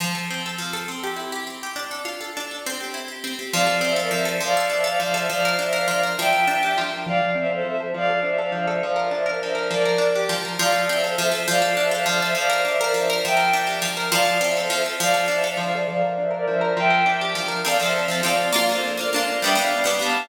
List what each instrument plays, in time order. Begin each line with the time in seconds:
0.00 pizzicato strings F3
0.15 pizzicato strings A4
0.30 pizzicato strings C4
0.46 pizzicato strings A4
0.58 pizzicato strings F3
0.73 pizzicato strings A4
0.88 pizzicato strings C4
1.03 pizzicato strings G4
1.16 pizzicato strings E4
1.32 pizzicato strings G4
1.47 pizzicato strings C4
1.63 pizzicato strings G4
1.76 pizzicato strings D4
1.91 pizzicato strings A4
2.05 pizzicato strings F4
2.21 pizzicato strings A4
2.37 pizzicato strings D4
2.51 pizzicato strings A4
2.66 pizzicato strings C4
2.80 pizzicato strings G4
2.94 pizzicato strings E4
3.08 pizzicato strings G4
3.24 pizzicato strings C4
3.39 pizzicato strings G4
3.53 pizzicato strings F3, violin D5 F5
3.67 pizzicato strings A4
3.81 pizzicato strings C4, violin C5 E5
3.96 pizzicato strings A4, violin A#4 D5
4.11 pizzicato strings F3, violin C5 E5
4.25 pizzicato strings A4
4.40 pizzicato strings F3, violin D5 F5
4.57 pizzicato strings A4
4.70 pizzicato strings D4, violin C5 E5
4.84 pizzicato strings A4, violin D5 F5
5.00 pizzicato strings F3, violin D5 F5
5.14 pizzicato strings A4, violin C5 E5
5.29 pizzicato strings F3, violin D5 F5
5.45 pizzicato strings A#4
5.59 pizzicato strings D4, violin C5 E5
5.73 pizzicato strings A#4, violin D5 F5
5.88 pizzicato strings F3, violin D5 F5
6.03 pizzicato strings A#4
6.17 pizzicato strings F3, violin E5 G5
6.33 pizzicato strings A#4
6.47 pizzicato strings D4
6.63 pizzicato strings G4
6.78 pizzicato strings F3
6.93 pizzicato strings A#4
7.06 pizzicato strings F3, violin D5 F5
7.20 pizzicato strings A4
7.35 pizzicato strings C4, violin C5 E5
7.49 pizzicato strings A4, violin A4 C5
7.64 pizzicato strings F3, violin C5 E5
7.80 pizzicato strings A4
7.94 pizzicato strings F3, violin D5 F5
8.10 pizzicato strings A4
8.23 pizzicato strings D4, violin C5 E5
8.38 pizzicato strings A4, violin D5 F5
8.52 pizzicato strings F3, violin D5 F5
8.67 pizzicato strings A4, violin C5 E5
8.82 pizzicato strings F3, violin D5 F5
8.96 pizzicato strings A#4
9.11 pizzicato strings D4, violin C5 E5
9.26 pizzicato strings A#4, violin A#4 D5
9.41 pizzicato strings F3, violin C5 E5
9.55 pizzicato strings A#4
9.70 pizzicato strings F3, violin A#4 D5
9.85 pizzicato strings A#4
9.98 pizzicato strings D4
10.15 pizzicato strings G4
10.29 pizzicato strings F3
10.45 pizzicato strings A#4
10.59 pizzicato strings F3, violin D5 F5
10.72 pizzicato strings A4
10.88 pizzicato strings C4, violin C5 E5
11.03 violin A4 C5, pizzicato strings A4
11.17 pizzicato strings F3, violin C5 E5
11.32 pizzicato strings A4
11.47 pizzicato strings F3, violin D5 F5
11.62 pizzicato strings A4
11.77 pizzicato strings D4, violin C5 E5
11.91 pizzicato strings A4, violin D5 F5
12.06 pizzicato strings F3, violin D5 F5
12.21 pizzicato strings A4, violin C5 E5
12.35 pizzicato strings F3, violin D5 F5
12.50 pizzicato strings A#4
12.65 pizzicato strings D4, violin C5 E5
12.80 violin A#4 D5, pizzicato strings A#4
12.94 pizzicato strings F3, violin C5 E5
13.10 pizzicato strings A#4
13.24 pizzicato strings F3, violin E5 G5
13.37 pizzicato strings A#4
13.53 pizzicato strings D4
13.67 pizzicato strings G4
13.82 pizzicato strings F3
13.97 pizzicato strings A#4
14.12 pizzicato strings F3, violin D5 F5
14.25 pizzicato strings A4
14.41 pizzicato strings C4, violin C5 E5
14.56 violin A4 C5, pizzicato strings A4
14.70 pizzicato strings F3, violin C5 E5
14.86 pizzicato strings A4
15.00 pizzicato strings F3, violin D5 F5
15.14 pizzicato strings A4
15.28 pizzicato strings D4, violin C5 E5
15.44 pizzicato strings A4, violin D5 F5
15.57 pizzicato strings F3, violin D5 F5
15.73 pizzicato strings A4, violin C5 E5
15.88 pizzicato strings F3, violin D5 F5
16.01 pizzicato strings A#4
16.18 pizzicato strings D4, violin C5 E5
16.31 pizzicato strings A#4, violin A#4 D5
16.47 pizzicato strings F3, violin C5 E5
16.61 pizzicato strings A#4
16.77 pizzicato strings F3, violin E5 G5
16.90 pizzicato strings A#4
17.06 pizzicato strings D4
17.21 pizzicato strings G4
17.35 pizzicato strings F3
17.48 pizzicato strings A#4
17.65 pizzicato strings F3 C4 A4, violin D5 F5
17.79 pizzicato strings F3 C4 A4, violin C5 E5
18.08 pizzicato strings F3 C4 A4
18.23 pizzicato strings F3 C4 A4, violin D5 F5
18.53 pizzicato strings A#3 D4 F4, violin D5 F5
18.68 pizzicato strings A#3 D4, violin A4 C5
18.72 pizzicato strings F4
18.97 pizzicato strings A#3 D4 F4, violin A#4 D5
19.12 pizzicato strings A#3 D4, violin D5 F5
19.16 pizzicato strings F4
19.41 pizzicato strings G3 B3, violin E5 G5
19.45 pizzicato strings D4
19.55 pizzicato strings G3 B3 D4, violin D5 F5
19.84 pizzicato strings G3 B3 D4
19.99 pizzicato strings G3 B3 D4, violin F5 A5